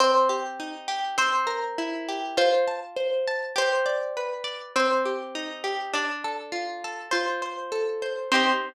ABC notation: X:1
M:2/4
L:1/8
Q:1/4=101
K:Cdor
V:1 name="Orchestral Harp"
c z3 | c z3 | c z3 | c2 z2 |
c z3 | d z3 | c2 z2 | c2 z2 |]
V:2 name="Orchestral Harp"
C G E G | C B =E G | F a c a | G d =B d |
C G E G | D A F A | F c A c | [CEG]2 z2 |]